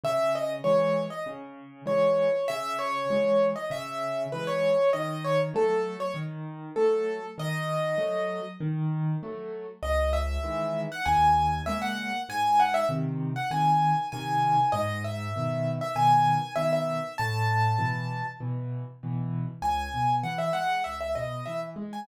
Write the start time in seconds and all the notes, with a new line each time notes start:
0.04 C#3 E5
0.35 D#5
0.64 E3 G#3 C#5
1.10 D#5
1.26 C#3
1.86 E3 G#3 C#5
2.48 C#3 E5
2.79 C#5
3.10 E3 G#3
3.56 D#5
3.70 C#3 E5
4.32 E3 G#3 B4
4.47 C#5
4.93 D#3 D#5
5.24 C#5
5.54 F#3 A3 A4
6.00 C#5
6.14 D#3
6.76 F#3 A3 A4
7.38 D#3 D#5
7.98 F#3 A3
8.60 D#3
9.23 F#3 A3
9.83 C#2 D#5
10.13 E5
10.43 D#3 E3 G#3
10.92 F#5
11.05 D#2 G#5
11.66 C#3 G#3 A#3 E5
11.82 F#5
12.29 G#2 G#5
12.60 F#5
12.74 E5
12.89 C3 D#3
13.36 F#5
13.51 C3 D#3 G#5
14.12 C3 D#3 G#5
14.72 G#2 D#5
15.04 E5
15.36 B2 D#3
15.81 E5
15.95 B2 D#3 G#5
16.55 B2 D#3 E5
16.73 E5
17.18 A2 A5
17.78 B2 E3
18.40 B2 E3
19.03 B2 E3
19.62 C#2 G#5
19.94 B2
20.23 E3 F#5
20.38 E5
20.53 G#3 F#5
20.84 C#2 E5
21.01 E5
21.15 B2 D#5
21.46 E3 E5
21.76 G#3
21.93 G#5